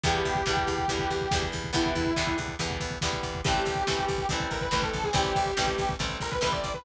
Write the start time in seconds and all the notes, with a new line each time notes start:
0.04 E2 D3 E3 G3 B3 G4, kick, closed hi-hat
0.14 kick
0.25 E2, kick, closed hi-hat
0.35 kick
0.46 E2 D3 E3 G3 B3, kick, snare
0.57 kick
0.67 E2, kick, closed hi-hat
0.78 kick
0.88 E2 D3 E3 G3 B3, kick, closed hi-hat
0.99 kick
1.10 E2, kick, closed hi-hat
1.21 kick
1.31 E2 D3 E3 G3 B3, kick, snare
1.42 kick
1.52 E2, kick, closed hi-hat
1.64 kick
1.73 E2 D3 E3 G3 B3 E4, kick, closed hi-hat
1.86 kick
1.95 E2, kick, closed hi-hat
2.06 kick
2.16 E2 D3 E3 G3 B3, kick, snare
2.27 kick
2.38 E2, kick, closed hi-hat
2.48 kick
2.59 E2 D3 E3 G3 B3, kick, closed hi-hat
2.71 kick
2.80 E2, kick, closed hi-hat
2.91 kick
3.01 E2 D3 E3 G3 B3, kick, snare
3.13 kick
3.23 E2, kick, closed hi-hat
3.35 kick
3.45 A1 E3 G3 A3 C4 G4, kick, closed hi-hat
3.54 kick
3.65 A1, kick, closed hi-hat
3.75 kick
3.87 A1 E3 G3 A3 C4, kick, snare
3.99 kick
4.08 A1, kick, closed hi-hat
4.18 kick
4.29 A1 E3 G3 A3 C4, kick, closed hi-hat
4.40 kick
4.50 A1 A#4, kick, closed hi-hat
4.61 B4, kick
4.71 A1 E3 G3 A3 C4 B4, kick, snare
4.82 A4, kick
4.93 A1, kick, closed hi-hat
5.04 G#4, kick
5.13 A1 E3 G3 A3 C4 G4, kick, closed hi-hat
5.24 kick
5.35 A1, kick, closed hi-hat
5.46 kick
5.57 A1 E3 G3 A3 C4, kick, snare
5.67 kick
5.78 A1, kick, closed hi-hat
5.89 kick
5.99 A1 E3 G3 A3 C4, kick, closed hi-hat
6.09 kick
6.20 A1 A#4, kick, closed hi-hat
6.31 B4, kick
6.41 A1 E3 G3 A3 C4 B4, kick, snare
6.52 D5, kick
6.64 A1, kick, closed hi-hat
6.74 B4, kick